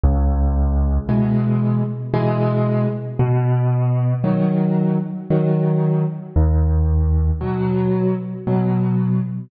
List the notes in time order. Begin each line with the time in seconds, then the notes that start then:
0.04 C#2
1.09 B2 E3 G#3
2.14 B2 E3 G#3
3.19 B2
4.24 D#3 F#3
5.30 D#3 F#3
6.36 D#2
7.41 B2 F#3
8.47 B2 F#3